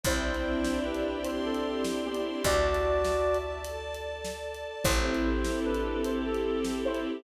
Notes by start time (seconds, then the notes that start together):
0.04 C2 C4 E4 C5 D5 E5 G5, kick, closed hi-hat
0.24 D4
0.35 closed hi-hat
0.44 E4
0.65 G4, snare
0.84 C4 D4 B4
0.95 closed hi-hat
1.04 D4
1.24 E4 C5 D5 G5 C6, closed hi-hat
1.45 C4 G4 A4
1.55 closed hi-hat
1.65 C4
1.85 D4, snare
2.04 B3 E4 G4
2.15 closed hi-hat
2.24 G4
2.44 D2 F#4 D5 E5 A5, kick, closed hi-hat
2.75 closed hi-hat
3.05 snare
3.35 closed hi-hat
3.64 A4 D5 A5, closed hi-hat
3.95 closed hi-hat
4.25 snare
4.54 closed hi-hat
4.84 A1 C4 E4 G4 A4 C5, kick, closed hi-hat
5.04 E4
5.15 closed hi-hat
5.25 G4
5.45 A4, snare
5.65 C4 D4 B4
5.75 closed hi-hat
5.85 E4
6.05 E4 G4 C5, closed hi-hat
6.25 C4 A4
6.35 closed hi-hat
6.44 C4
6.64 E4, snare
6.85 E4 G4 C5
6.95 closed hi-hat
7.05 A4